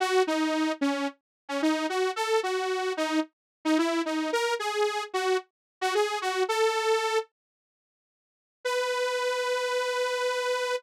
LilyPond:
\new Staff { \time 4/4 \key b \mixolydian \tempo 4 = 111 fis'8 dis'4 cis'8 r8. cis'16 dis'8 fis'8 | a'8 fis'4 dis'8 r8. dis'16 e'8 dis'8 | ais'8 gis'4 fis'8 r8. fis'16 gis'8 fis'8 | a'4. r2 r8 |
b'1 | }